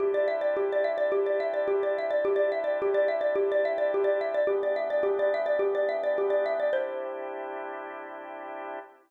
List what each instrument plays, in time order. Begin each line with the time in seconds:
0.00 drawbar organ C3 D4 E4 G4, xylophone G4
0.14 xylophone D5
0.28 xylophone E5
0.41 xylophone D5
0.57 xylophone G4
0.72 xylophone D5
0.84 xylophone E5
0.98 xylophone D5
1.12 xylophone G4
1.26 xylophone D5
1.40 xylophone E5
1.54 xylophone D5
1.68 xylophone G4
1.83 xylophone D5
1.98 xylophone E5
2.11 xylophone D5
2.25 xylophone G4
2.36 xylophone D5
2.52 xylophone E5
2.64 xylophone D5
2.82 xylophone G4
2.94 xylophone D5
3.08 xylophone E5
3.21 xylophone D5
3.36 xylophone G4
3.52 xylophone D5
3.65 xylophone E5
3.78 xylophone D5
3.94 xylophone G4
4.04 xylophone D5
4.21 xylophone E5
4.34 xylophone D5
4.47 drawbar organ E3 B3 D4 G4, xylophone G4
4.63 xylophone D5
4.76 xylophone E5
4.90 xylophone D5
5.03 xylophone G4
5.19 xylophone D5
5.34 xylophone E5
5.46 xylophone D5
5.59 xylophone G4
5.75 xylophone D5
5.89 xylophone E5
6.04 xylophone D5
6.18 xylophone G4
6.30 xylophone D5
6.46 xylophone E5
6.60 xylophone D5
6.73 drawbar organ C3 D4 E4 G4, xylophone C5